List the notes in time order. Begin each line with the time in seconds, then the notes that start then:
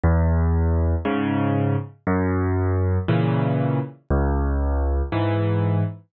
0.04 E2
1.05 G#2 C#3
2.07 F#2
3.08 A#2 C#3 E3
4.10 C#2
5.12 G#2 E3